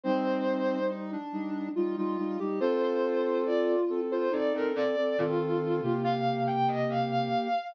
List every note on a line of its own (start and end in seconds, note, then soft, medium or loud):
0.03 1.17 G3 medium
0.03 0.79 C4 loud
0.03 1.17 D#4 medium
0.03 0.84 C5 loud
0.90 1.11 D#4 loud
1.12 1.69 D4 loud
1.32 1.69 G3 medium
1.32 1.69 D#4 medium
1.75 1.96 G3 medium
1.75 1.96 D#4 medium
1.75 1.96 F4 loud
1.97 2.17 G3 medium
1.97 2.17 D#4 medium
1.97 2.40 F4 loud
2.17 2.38 G3 medium
2.17 2.38 D#4 medium
2.39 2.60 G3 medium
2.39 2.60 D#4 medium
2.39 2.59 G4 medium
2.60 3.76 C4 medium
2.60 3.43 F4 loud
2.60 3.76 A4 medium
2.60 2.81 C5 loud
2.83 3.38 C5 loud
3.46 4.01 F4 medium
3.46 3.67 D5 loud
3.89 4.29 C4 medium
3.89 4.29 A4 medium
4.11 4.32 F4 loud
4.11 4.32 C5 loud
4.31 4.52 C4 medium
4.31 4.72 D#4 loud
4.31 4.52 A4 medium
4.31 4.53 D5 medium
4.54 4.74 C4 medium
4.54 4.74 A4 medium
4.54 4.75 A#4 loud
4.75 4.95 C4 medium
4.75 4.95 A4 medium
4.75 5.17 D5 loud
4.96 5.17 C4 medium
4.96 5.17 A4 medium
5.18 5.81 D#3 loud
5.18 5.81 C4 medium
5.18 6.01 F4 loud
5.18 5.81 A4 medium
5.83 7.29 C3 loud
5.83 7.48 A#3 medium
5.83 7.48 G4 medium
6.04 6.40 F5 loud
6.47 6.68 G5 medium
6.68 6.88 D#5 loud
6.89 7.10 F5 medium
7.12 7.67 F5 loud